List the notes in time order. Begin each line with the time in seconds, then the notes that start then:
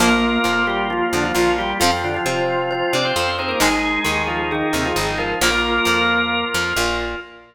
0.00 A#1 F3 A#3 F4 A#4
0.44 F2 F3 F4
0.67 G3 G4
0.90 F3 F4
1.13 F2 D3 F3 D4
1.23 F3 F4
1.34 A#1 A#2 F3 F4
1.58 G3 F4 G4
1.80 F2 F3 C4 F4
2.04 D3 D4
2.14 F3 F4
2.26 C3 F3 C4 F4 C5
2.71 F3 F4 C5
2.93 C3 C4 D4 D5
3.05 C4 C5
3.16 F2 F3 C4 C5
3.39 C4 D#4 G#4 C5
3.48 A#3 A#4
3.60 G#1 D#3 G#3 D#4 G#4
4.05 D#2 D#3 G#4
4.27 F3 F4
4.51 D#3 D#4 G#4
4.73 D#2 C3 D#3 C4
4.85 F3 F4
4.96 G#1 G#2 D#3 D#4
5.18 F3 F4 A#4
5.41 A#1 F3 A#3 F4 A#4
5.85 F2 F3
6.54 F2 F3
6.76 A#1 A#2